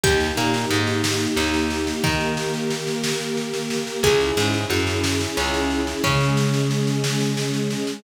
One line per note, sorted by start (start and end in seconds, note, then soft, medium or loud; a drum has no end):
0.03 0.32 D#2 medium
0.03 2.02 A#3 medium
0.03 2.02 D#4 loud
0.03 0.34 G4 loud
0.03 2.02 G4 medium
0.03 kick loud
0.03 snare medium
0.20 snare medium
0.37 0.66 A#2 medium
0.37 0.66 A#3 medium
0.37 snare medium
0.54 snare medium
0.70 1.27 G#2 medium
0.70 1.27 G#3 medium
0.70 snare medium
0.87 snare medium
1.04 snare loud
1.20 snare medium
1.37 1.93 D#2 medium
1.37 1.94 D#4 medium
1.37 snare medium
1.54 snare medium
1.70 snare medium
1.87 snare medium
2.04 3.74 D#3 medium
2.04 4.02 A#3 medium
2.04 3.74 D#4 medium
2.04 4.02 G4 medium
2.04 4.02 A#4 loud
2.04 kick loud
2.04 snare medium
2.20 snare medium
2.37 snare medium
2.54 snare medium
2.70 snare medium
2.87 snare medium
3.04 snare loud
3.20 snare medium
3.37 snare medium
3.54 snare medium
3.70 snare medium
3.87 snare medium
4.03 4.31 C#2 medium
4.03 6.02 C#4 medium
4.03 6.02 E4 loud
4.03 4.34 G#4 loud
4.03 6.02 G#4 loud
4.03 kick loud
4.03 snare medium
4.20 snare medium
4.37 4.65 G#2 medium
4.37 4.65 G#3 medium
4.37 snare medium
4.54 snare medium
4.70 5.26 F#2 medium
4.70 5.27 F#4 medium
4.70 snare medium
4.87 snare medium
5.04 snare loud
5.20 snare medium
5.37 5.94 C#2 medium
5.37 5.94 C#4 medium
5.37 snare medium
5.54 snare medium
5.70 snare medium
5.87 snare medium
6.04 7.74 C#3 medium
6.04 8.02 G#3 loud
6.04 7.74 C#4 medium
6.04 8.02 C#4 medium
6.04 8.02 G#4 medium
6.04 kick loud
6.04 snare medium
6.20 snare medium
6.37 snare medium
6.54 snare medium
6.71 snare medium
6.87 snare medium
7.04 snare loud
7.20 snare medium
7.37 snare medium
7.54 snare medium
7.70 snare medium
7.87 snare medium